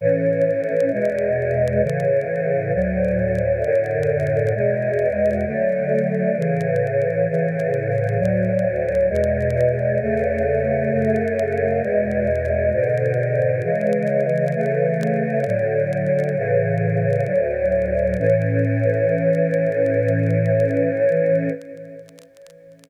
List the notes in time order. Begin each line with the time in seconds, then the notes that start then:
0.01 A2 E3 C#4
0.92 E2 B2 G#3
1.82 A2 C#3 E3
2.74 D2 A2 F#3
3.63 F#2 A2 D3
4.55 E2 B2 G#3
5.46 D3 F#3 A3
6.37 A2 C#3 E3
7.29 A2 C#3 E3
8.18 D2 A2 F#3
9.09 E2 B2 G#3
10.01 E2 C#3 A3
10.91 F#2 C#3 A3
11.82 E2 B2 G#3
12.72 G#2 B2 D3
13.63 C#3 E3 G#3
14.54 C#3 E3 A3
15.46 A2 D3 F#3
16.37 A2 C#3 E3
17.26 D2 A2 F#3
18.19 A2 E3 C#4